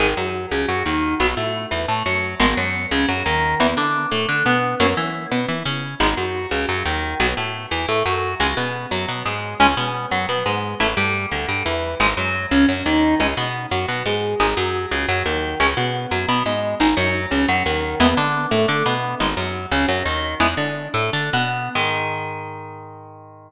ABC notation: X:1
M:7/8
L:1/8
Q:1/4=175
K:G#m
V:1 name="Overdriven Guitar"
[D,G,] F,2 C, F, D,2 | [F,B,] =A,2 E, A, F,2 | [D,G,B,] F,2 C, F, D,2 | [E,B,] =D2 =A, D B,2 |
[F,A,C] E2 B, E C2 | [G,B,D] F,2 C, F, D,2 | [F,B,] =A,2 E, A, F,2 | [G,C] B,2 F, B, G,2 |
[G,C] B,2 F, B, G,2 | [=A,E] =G,2 =D, G, E,2 | [G,D] F,2 C, F, D,2 | [G,C] B,2 F, B, G,2 |
[G,D] F,2 C, F, D,2 | [G,C] B,2 F, B, G,2 | [G,D] F,2 C, F, D,2 | [G,B,E] =D2 =A, D B,2 |
[G,D] F,2 C, F, D,2 | "^rit." [G,B,E] =D2 =A, D B,2 | [D,G,]7 |]
V:2 name="Electric Bass (finger)" clef=bass
G,,, F,,2 C,, F,, D,,2 | B,,, =A,,2 E,, A,, F,,2 | G,,, F,,2 C,, F,, D,,2 | E,, =D,2 =A,, D, B,,2 |
F,, E,2 B,, E, C,2 | G,,, F,,2 C,, F,, D,,2 | B,,, =A,,2 E,, A,, F,,2 | C,, B,,2 F,, B,, G,,2 |
C,, B,,2 F,, B,, G,,2 | =A,,, =G,,2 =D,, G,, E,,2 | G,,, F,,2 C,, F,, D,,2 | C,, B,,2 F,, B,, G,,2 |
G,,, F,,2 C,, F,, D,,2 | C,, B,,2 F,, B,, G,,2 | G,,, F,,2 C,, F,, D,,2 | E,, =D,2 =A,, D, B,,2 |
G,,, F,,2 C,, F,, D,,2 | "^rit." E,, =D,2 =A,, D, B,,2 | G,,7 |]